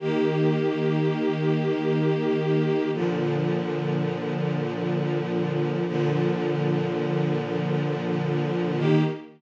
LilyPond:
\new Staff { \time 4/4 \key ees \major \tempo 4 = 82 <ees bes g'>1 | <bes, d f>1 | <bes, d f>1 | <ees bes g'>4 r2. | }